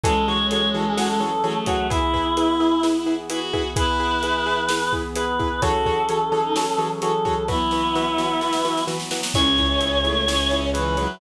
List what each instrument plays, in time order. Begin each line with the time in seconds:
0.03 acoustic grand piano E3 F#4 G#4 A4 C#5, brass section E3 F#3 C#4 G#4 A4, violin G#3, choir aahs A4, kick, closed hi-hat
0.27 acoustic grand piano E3 F#4 G#4 A4 C#5, choir aahs C#5
0.50 acoustic grand piano E3 F#4 G#4 A4 C#5, choir aahs C#5, closed hi-hat
0.74 acoustic grand piano E3 F#4 G#4 A4 C#5, choir aahs A4
0.87 choir aahs G#4
0.97 acoustic grand piano E3 F#4 G#4 A4 C#5, choir aahs F#4, snare
1.08 choir aahs A4
1.20 acoustic grand piano E3 F#4 G#4 A4 C#5
1.44 acoustic grand piano E3 F#4 G#4 A4 C#5, violin A3
1.66 acoustic grand piano E3 F#4 G#4 A4 C#5, choir aahs F#4, kick, closed hi-hat
1.90 brass section E3 B3 G#4, violin E4, acoustic grand piano E4 G#4 B4, choir aahs E4, kick, closed hi-hat
2.14 acoustic grand piano E4 G#4 B4, kick
2.37 violin E4, acoustic grand piano E4 G#4 B4, closed hi-hat
2.60 acoustic grand piano E4 G#4 B4
2.83 acoustic grand piano E4 G#4 B4, snare
3.06 acoustic grand piano E4 G#4 B4
3.30 acoustic grand piano E4 G#4 B4, violin F#4, closed hi-hat
3.53 acoustic grand piano E4 G#4 B4, kick
3.76 brass section E3 B3 G#4, acoustic grand piano E4 G#4 B4, violin E4, choir aahs B4, kick, closed hi-hat
4.00 acoustic grand piano E4 G#4 B4
4.23 acoustic grand piano E4 G#4 B4, closed hi-hat
4.46 acoustic grand piano E4 G#4 B4
4.69 acoustic grand piano E4 G#4 B4, snare
4.93 acoustic grand piano E4 G#4 B4, kick
5.15 acoustic grand piano E4 G#4 B4, choir aahs B4, closed hi-hat
5.39 acoustic grand piano E4 G#4 B4, kick
5.62 acoustic grand piano E3 F#4 G#4 A4 C#5, brass section E3 F#3 C#4 G#4 A4, violin F#4, choir aahs A4, kick, closed hi-hat
5.86 acoustic grand piano E3 F#4 G#4 A4 C#5, kick
6.09 acoustic grand piano E3 F#4 G#4 A4 C#5, closed hi-hat
6.32 acoustic grand piano E3 F#4 G#4 A4 C#5
6.44 violin D#4
6.56 acoustic grand piano E3 F#4 G#4 A4 C#5, snare
6.78 acoustic grand piano E3 F#4 G#4 A4 C#5
7.02 acoustic grand piano E3 F#4 G#4 A4 C#5, choir aahs A4, closed hi-hat
7.25 acoustic grand piano E3 F#4 G#4 A4 C#5, kick
7.48 brass section E3 F#3 B3, acoustic grand piano E3 F#4 B4, violin B3, choir aahs E4, kick, snare
7.71 acoustic grand piano E3 F#4 B4, snare
7.95 acoustic grand piano E3 F#4 B4, snare
8.18 acoustic grand piano E3 F#4 B4, snare
8.41 acoustic grand piano E3 F#4 B4, snare
8.53 snare
8.65 acoustic grand piano E3 F#4 B4, snare
8.77 snare
8.87 acoustic grand piano E3 F#4 B4, snare
9.00 snare
9.11 acoustic grand piano E3 F#4 B4, snare
9.23 snare
9.34 violin C#2 C#4, acoustic grand piano E4 G#4 C#5, choir aahs C#5, brass section C#5 E5 G#5, kick, crash
9.58 acoustic grand piano E4 G#4 C#5, kick, closed hi-hat
9.81 acoustic grand piano E4 G#4 C#5, closed hi-hat
10.04 violin A3, acoustic grand piano E4 G#4 C#5, closed hi-hat
10.28 violin C#4, acoustic grand piano E4 G#4 C#5, snare
10.51 acoustic grand piano E4 G#4 C#5, closed hi-hat
10.73 violin E3, acoustic grand piano E4 G#4 C#5, choir aahs B4, closed hi-hat
10.97 violin F#3, acoustic grand piano E4 G#4 C#5, closed hi-hat